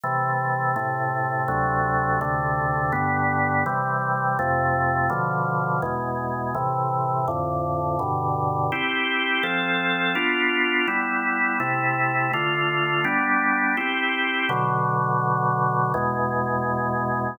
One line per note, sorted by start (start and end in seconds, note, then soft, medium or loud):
0.03 0.75 C3 medium
0.03 0.75 E3 medium
0.03 0.75 A3 medium
0.76 1.47 A2 medium
0.76 1.47 C3 medium
0.76 1.47 A3 medium
1.48 2.20 D2 medium
1.48 2.20 C3 medium
1.48 2.20 F#3 medium
1.48 2.20 A3 medium
2.21 2.93 D2 medium
2.21 2.93 C3 medium
2.21 2.92 D3 medium
2.21 2.93 A3 medium
2.92 3.64 G2 medium
2.92 3.64 D3 medium
2.92 3.64 B3 medium
3.66 4.38 C3 medium
3.66 4.38 E3 medium
3.66 4.38 G3 medium
4.39 5.10 F2 medium
4.39 5.10 C3 medium
4.39 5.10 A3 loud
5.10 5.81 B2 medium
5.10 5.81 D3 medium
5.10 5.81 F3 medium
5.82 6.54 E2 medium
5.82 6.54 B2 medium
5.82 6.54 G#3 medium
6.55 7.26 A2 medium
6.55 7.26 C3 medium
6.55 7.26 E3 medium
7.28 7.99 F2 medium
7.28 7.99 A2 medium
7.28 7.99 D3 medium
7.99 8.71 G2 medium
7.99 8.71 B2 medium
7.99 8.71 D3 medium
8.72 9.43 C4 medium
8.72 9.44 E4 medium
8.72 9.44 G4 medium
9.43 10.15 F3 medium
9.43 10.15 C4 medium
9.43 10.15 A4 medium
10.15 10.87 B3 medium
10.15 10.87 D4 medium
10.15 10.87 F4 medium
10.88 11.59 G3 medium
10.88 11.59 B3 medium
10.88 11.59 E4 medium
11.60 12.31 C3 medium
11.60 12.31 A3 medium
11.60 12.31 E4 medium
12.33 13.05 D3 medium
12.33 13.05 A3 medium
12.33 13.05 F4 medium
13.04 13.76 G3 medium
13.04 13.76 B3 medium
13.04 13.76 D4 medium
13.77 14.49 C4 medium
13.77 14.49 E4 medium
13.77 14.49 G4 medium
14.49 15.92 B2 medium
14.49 15.92 D3 medium
14.49 15.92 F#3 medium
15.94 17.37 E2 medium
15.94 17.37 B2 medium
15.94 17.37 G#3 loud